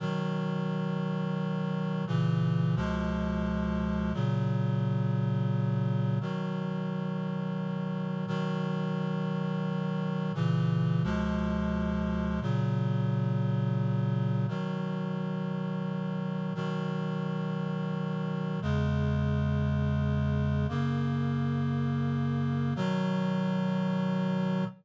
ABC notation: X:1
M:3/4
L:1/8
Q:1/4=87
K:B
V:1 name="Clarinet"
[B,,D,F,]6 | [A,,C,E,]2 [C,,B,,^E,G,]4 | [A,,C,F,]6 | [B,,D,F,]6 |
[B,,D,F,]6 | [A,,C,E,]2 [C,,B,,^E,G,]4 | [A,,C,F,]6 | [B,,D,F,]6 |
[B,,D,F,]6 | [E,,C,G,]6 | [F,,C,A,]6 | [B,,D,F,]6 |]